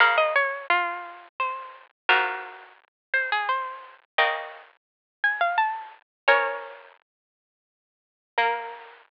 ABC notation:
X:1
M:3/4
L:1/16
Q:1/4=86
K:Bbm
V:1 name="Harpsichord"
f e d2 F4 c4 | [GB]6 c A c4 | [e=g]6 a f =a4 | [Bd]8 z4 |
B12 |]
V:2 name="Harpsichord"
[D,B,]12 | [A,,F,]12 | [D,B,]12 | [F,D]12 |
B,12 |]